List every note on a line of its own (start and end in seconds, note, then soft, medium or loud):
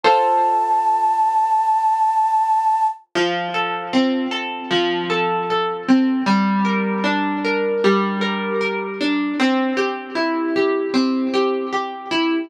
0.03 3.10 F4 medium
0.03 3.10 A4 medium
0.03 3.10 C5 medium
0.03 2.87 A5 medium
3.15 4.70 F3 loud
3.54 4.31 A4 medium
3.93 5.88 C4 medium
4.31 5.09 A4 medium
4.71 6.19 F3 medium
5.10 5.50 A4 medium
5.50 6.24 A4 medium
5.88 6.25 C4 medium
6.26 7.84 G3 loud
6.65 7.44 A#4 medium
7.04 9.00 D4 medium
7.44 8.21 A#4 medium
7.84 9.32 G3 medium
8.21 8.60 A#4 medium
8.61 9.35 A#4 medium
9.01 9.38 D4 medium
9.39 10.93 C4 loud
9.77 10.55 G4 medium
10.15 12.11 E4 medium
10.56 11.33 G4 medium
10.94 12.42 C4 medium
11.34 11.72 G4 medium
11.73 12.47 G4 medium
12.11 12.48 E4 medium